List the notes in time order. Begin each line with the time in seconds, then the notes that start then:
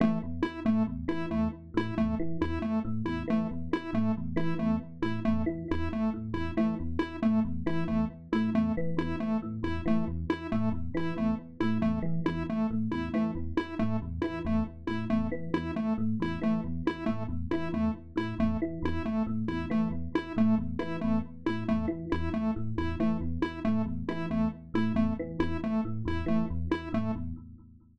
0.00 E3 A3
0.23 E2
0.43 E4
0.65 A2 A3
0.87 E2
1.08 E3 E4
1.31 E2 A3
1.74 A2 E4
1.97 E2 A3
2.19 E3
2.41 E2 E4
2.62 A3
2.85 A2
3.05 E2 E4
3.28 E3 A3
3.51 E2
3.73 E4
3.93 A2 A3
4.17 E2
4.36 E3 E4
4.59 E2 A3
5.02 A2 E4
5.25 E2 A3
5.46 E3
5.71 E2 E4
5.93 A3
6.14 A2
6.33 E2 E4
6.57 E3 A3
6.80 E2
6.99 E4
7.22 A2 A3
7.45 E2
7.66 E3 E4
7.88 E2 A3
8.32 A2 E4
8.54 E2 A3
8.77 E3
8.97 E2 E4
9.20 A3
9.42 A2
9.63 E2 E4
9.86 E3 A3
10.08 E2
10.30 E4
10.52 A2 A3
10.72 E2
10.94 E3 E4
11.16 E2 A3
11.60 A2 E4
11.81 E2 A3
12.02 E3
12.26 E2 E4
12.49 A3
12.71 A2
12.91 E2 E4
13.14 E3 A3
13.35 E2
13.57 E4
13.79 A2 A3
14.02 E2
14.22 E3 E4
14.45 E2 A3
14.87 A2 E4
15.10 E2 A3
15.32 E3
15.54 E2 E4
15.76 A3
15.98 A2
16.20 E2 E4
16.42 E3 A3
16.64 E2
16.87 E4
17.06 A2 A3
17.29 E2
17.51 E3 E4
17.72 E2 A3
18.16 A2 E4
18.39 E2 A3
18.62 E3
18.82 E2 E4
19.05 A3
19.27 A2
19.48 E2 E4
19.70 E3 A3
19.91 E2
20.15 E4
20.36 A2 A3
20.58 E2
20.79 E3 E4
21.01 E2 A3
21.46 A2 E4
21.68 E2 A3
21.88 E3
22.12 E2 E4
22.34 A3
22.56 A2
22.78 E2 E4
23.00 E3 A3
23.21 E2
23.42 E4
23.65 A2 A3
23.86 E2
24.09 E3 E4
24.30 E2 A3
24.74 A2 E4
24.95 E2 A3
25.19 E3
25.39 E2 E4
25.64 A3
25.85 A2
26.05 E2 E4
26.26 E3 A3
26.50 E2
26.71 E4
26.92 A2 A3
27.16 E2